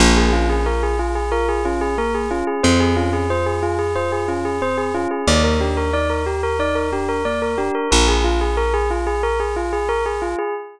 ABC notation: X:1
M:4/4
L:1/16
Q:1/4=91
K:Bbdor
V:1 name="Tubular Bells"
B A F A B A F A B A F A B A F A | c A F A c A F A c A F A c A F A | =d B G B d B G B d B G B d B G B | B A F A B A F A B A F A B A F A |]
V:2 name="Electric Piano 1"
B,2 D2 F2 A2 F2 D2 B,2 D2 | C2 D2 F2 A2 F2 D2 C2 D2 | B,2 =D2 E2 G2 E2 D2 B,2 D2 | z16 |]
V:3 name="Electric Bass (finger)" clef=bass
B,,,16 | F,,16 | E,,16 | B,,,16 |]